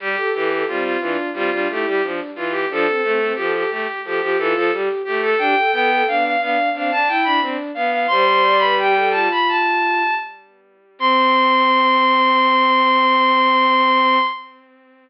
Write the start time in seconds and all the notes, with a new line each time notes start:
0.00 G3 G4
0.17 A4
0.33 E3 G4 A4
0.50 A4
0.67 G3 C4 F4
0.84 F4
1.00 E3 D4 F4
1.34 G3 C4 F4
1.51 G3 D4 F4
1.69 A3 E4 G4
1.86 G3 G4
2.02 F3 D4
2.36 E3 F4
2.51 G4
2.69 F3 D4 A4
2.87 C4
3.02 A3 C4 A4
3.20 C4
3.35 F3 G4 A4
3.55 G4
3.70 A3 G4
4.04 F3 G4 A4
4.21 F3 G4
4.38 E3 F4 A4
4.55 F3 A4
4.72 G3 G4
5.04 A3 G4
5.22 A4
5.38 D4 G4 G5
5.56 A4
5.72 B3 A4 G5
5.90 A4
6.07 B3 D4 F5
6.24 F5
6.40 B3 D4 F5
6.74 C4 D4 F5
6.91 D4 A5
7.07 E4 G5
7.24 D4 B5
7.41 C4 D4
7.74 B3 F5
7.91 F5
8.07 G3 C5 C6
8.27 C5
8.43 D5
8.58 B4 B5
8.77 G4 G5
8.96 A4
9.11 F4 A5
9.31 B5
9.48 A5
10.99 C4 C6